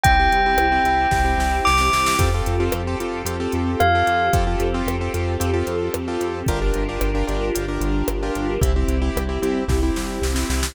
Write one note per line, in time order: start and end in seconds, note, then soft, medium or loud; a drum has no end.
0.03 0.29 C2 loud
0.03 2.16 C4 medium
0.03 0.16 C4 loud
0.03 2.16 E4 medium
0.03 0.16 E4 loud
0.03 2.16 G4 medium
0.03 0.16 G4 loud
0.03 1.56 G5 medium
0.03 kick loud
0.03 closed hi-hat loud
0.19 0.41 C4 loud
0.19 0.41 E4 loud
0.19 0.41 G4 loud
0.32 0.55 C2 medium
0.32 closed hi-hat medium
0.46 0.67 C4 medium
0.46 0.67 E4 loud
0.46 0.67 G4 loud
0.57 0.80 C2 medium
0.57 cross-stick loud
0.72 0.83 C4 loud
0.72 0.83 E4 medium
0.72 0.83 G4 loud
0.84 1.07 C2 medium
0.84 1.07 C4 loud
0.84 1.07 E4 loud
0.84 1.07 G4 loud
0.84 closed hi-hat medium
1.11 1.35 C2 medium
1.11 1.22 C4 medium
1.11 1.22 E4 loud
1.11 1.22 G4 medium
1.11 kick medium
1.11 snare medium
1.24 1.67 C4 loud
1.24 1.67 E4 medium
1.24 1.67 G4 loud
1.38 1.61 C2 medium
1.38 snare medium
1.65 1.90 C2 medium
1.65 2.15 D6 medium
1.65 snare medium
1.78 2.13 C4 medium
1.78 2.13 E4 medium
1.78 2.13 G4 medium
1.78 snare medium
1.93 2.16 C2 medium
1.93 snare medium
2.06 snare loud
2.19 2.42 F2 loud
2.19 2.30 C4 loud
2.19 4.32 C4 medium
2.19 2.30 F4 loud
2.19 4.32 F4 medium
2.19 2.30 G4 loud
2.19 4.32 G4 medium
2.19 2.30 A4 loud
2.19 4.32 A4 medium
2.19 kick loud
2.19 closed hi-hat loud
2.34 2.56 C4 medium
2.34 2.56 F4 loud
2.34 2.56 G4 medium
2.34 2.56 A4 loud
2.46 2.70 F2 medium
2.46 closed hi-hat medium
2.60 2.81 C4 loud
2.60 2.81 F4 loud
2.60 2.81 G4 loud
2.60 2.81 A4 medium
2.72 2.96 F2 medium
2.72 cross-stick loud
2.87 2.98 C4 loud
2.87 2.98 F4 medium
2.87 2.98 G4 loud
2.87 2.98 A4 loud
3.00 3.23 F2 medium
3.00 3.22 C4 medium
3.00 3.22 F4 medium
3.00 3.22 G4 medium
3.00 3.22 A4 medium
3.00 closed hi-hat medium
3.25 3.48 F2 medium
3.25 3.36 C4 medium
3.25 3.36 F4 loud
3.25 3.36 G4 loud
3.25 3.36 A4 medium
3.25 closed hi-hat loud
3.40 3.83 C4 medium
3.40 3.83 F4 medium
3.40 3.83 G4 loud
3.40 3.83 A4 loud
3.52 3.76 F2 medium
3.52 closed hi-hat medium
3.80 4.03 F2 medium
3.80 4.29 F5 medium
3.80 cross-stick loud
3.95 4.27 C4 loud
3.95 4.27 F4 loud
3.95 4.27 G4 medium
3.95 4.27 A4 medium
4.07 4.30 F2 medium
4.07 closed hi-hat medium
4.33 4.56 F2 loud
4.33 4.44 C4 loud
4.33 6.45 C4 medium
4.33 4.44 F4 loud
4.33 6.45 F4 medium
4.33 4.44 G4 loud
4.33 6.45 G4 medium
4.33 4.44 A4 loud
4.33 6.45 A4 medium
4.33 kick loud
4.33 closed hi-hat loud
4.47 4.68 C4 medium
4.47 4.68 F4 medium
4.47 4.68 G4 medium
4.47 4.68 A4 medium
4.60 4.82 F2 medium
4.60 closed hi-hat medium
4.74 4.96 C4 loud
4.74 4.96 F4 loud
4.74 4.96 G4 loud
4.74 4.96 A4 medium
4.86 5.09 F2 medium
4.86 cross-stick loud
5.01 5.12 C4 loud
5.01 5.12 F4 medium
5.01 5.12 G4 medium
5.01 5.12 A4 medium
5.14 5.37 F2 medium
5.14 5.35 C4 medium
5.14 5.35 F4 loud
5.14 5.35 G4 medium
5.14 5.35 A4 medium
5.14 closed hi-hat medium
5.40 5.63 F2 medium
5.40 5.51 C4 loud
5.40 5.51 F4 medium
5.40 5.51 G4 medium
5.40 5.51 A4 loud
5.40 closed hi-hat loud
5.54 5.96 C4 loud
5.54 5.96 F4 loud
5.54 5.96 G4 medium
5.54 5.96 A4 loud
5.67 5.90 F2 medium
5.67 closed hi-hat medium
5.94 6.18 F2 medium
5.94 cross-stick loud
6.08 6.40 C4 medium
6.08 6.40 F4 loud
6.08 6.40 G4 loud
6.08 6.40 A4 loud
6.20 6.43 F2 medium
6.20 closed hi-hat medium
6.46 6.72 G1 loud
6.46 8.60 D4 medium
6.46 6.59 D4 loud
6.46 8.60 F4 medium
6.46 6.59 F4 loud
6.46 8.60 G4 medium
6.46 6.59 G4 loud
6.46 8.60 A#4 medium
6.46 6.59 A#4 loud
6.46 kick loud
6.46 closed hi-hat medium
6.62 6.83 D4 loud
6.62 6.83 F4 medium
6.62 6.83 G4 medium
6.62 6.83 A#4 medium
6.74 6.98 G1 medium
6.74 closed hi-hat medium
6.89 7.10 D4 medium
6.89 7.10 F4 loud
6.89 7.10 G4 loud
6.89 7.10 A#4 medium
7.01 7.24 G1 medium
7.01 cross-stick loud
7.15 7.25 D4 loud
7.15 7.25 F4 medium
7.15 7.25 G4 medium
7.15 7.25 A#4 loud
7.27 7.51 G1 loud
7.27 7.49 D4 loud
7.27 7.49 F4 loud
7.27 7.49 G4 medium
7.27 7.49 A#4 medium
7.27 closed hi-hat medium
7.55 7.79 G1 medium
7.55 7.66 D4 medium
7.55 7.66 F4 loud
7.55 7.66 G4 medium
7.55 7.66 A#4 medium
7.55 closed hi-hat loud
7.68 8.11 D4 medium
7.68 8.11 F4 medium
7.68 8.11 G4 medium
7.68 8.11 A#4 loud
7.81 8.03 G1 loud
7.81 closed hi-hat medium
8.08 8.31 G1 medium
8.08 cross-stick loud
8.23 8.55 D4 loud
8.23 8.55 F4 loud
8.23 8.55 G4 loud
8.23 8.55 A#4 medium
8.35 8.58 G1 medium
8.35 closed hi-hat medium
8.61 8.84 C2 loud
8.61 8.72 C4 loud
8.61 10.74 C4 medium
8.61 8.72 E4 loud
8.61 10.74 E4 medium
8.61 8.72 G4 loud
8.61 10.74 G4 medium
8.61 kick loud
8.61 closed hi-hat loud
8.76 8.97 C4 loud
8.76 8.97 E4 medium
8.76 8.97 G4 loud
8.88 9.11 C2 medium
8.88 closed hi-hat medium
9.02 9.23 C4 medium
9.02 9.23 E4 loud
9.02 9.23 G4 loud
9.16 9.39 C2 medium
9.16 cross-stick loud
9.29 9.40 C4 medium
9.29 9.40 E4 loud
9.29 9.40 G4 medium
9.42 9.65 C2 medium
9.42 9.64 C4 loud
9.42 9.64 E4 loud
9.42 9.64 G4 loud
9.42 closed hi-hat medium
9.68 9.91 C2 medium
9.68 9.79 C4 medium
9.68 9.79 E4 medium
9.68 9.79 G4 loud
9.68 kick medium
9.68 snare medium
9.83 10.26 C4 medium
9.83 10.26 E4 loud
9.83 10.26 G4 medium
9.96 10.19 C2 medium
9.96 snare medium
10.22 10.45 C2 medium
10.22 snare medium
10.35 10.67 C4 loud
10.35 10.67 E4 loud
10.35 10.67 G4 medium
10.35 snare medium
10.50 10.72 C2 medium
10.50 snare medium
10.63 snare loud